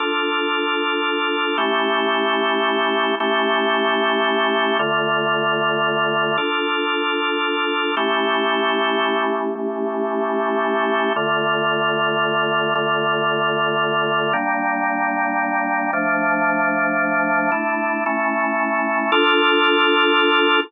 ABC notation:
X:1
M:9/8
L:1/8
Q:3/8=113
K:Dm
V:1 name="Drawbar Organ"
[DFA]9 | [A,^CEG]9 | [A,^CEG]9 | [D,A,F]9 |
[DFA]9 | [A,^CEG]9 | [A,^CEG]9 | [D,A,F]9 |
[D,A,F]9 | [G,B,D]9 | [F,A,D]9 | [A,DE]3 [A,^CE]6 |
[DFA]9 |]